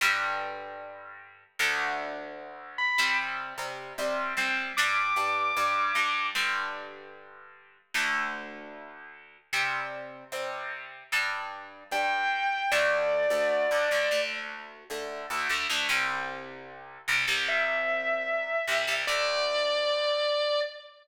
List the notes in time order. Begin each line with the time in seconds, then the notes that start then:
0.01 G2 D3 G3
1.59 D2 D3 A3
2.78 B5
2.98 C3 G3 C4
3.58 C3 G3 C4
3.98 C3 G3 C4
4.37 C3 G3 C4
4.77 G2 G3 D4 D6
5.16 G2 G3 D4
5.57 G2 G3 D4
5.95 G2 G3 D4
6.35 G2 D3 G3
7.94 D2 D3 A3
9.53 C3 G3 C4
10.32 C3 G3 C4
11.12 G2 G3 D4
11.91 G2 G3 D4 G5
12.72 D2 D3 A3 D5
13.30 D2 D3 A3
13.71 D2 D3 A3
13.91 D2 D3 A3
14.11 D2 D3 A3
14.90 D2 D3 A3
15.30 D2 D3 A3
15.49 D2 D3 A3
15.70 D2 D3 A3
15.89 C2 C3 G3
17.08 C2 C3 G3
17.28 C2 C3 G3
17.48 E5
18.68 C2 C3 G3
18.87 C2 C3 G3
19.07 D2 D3 A3 D5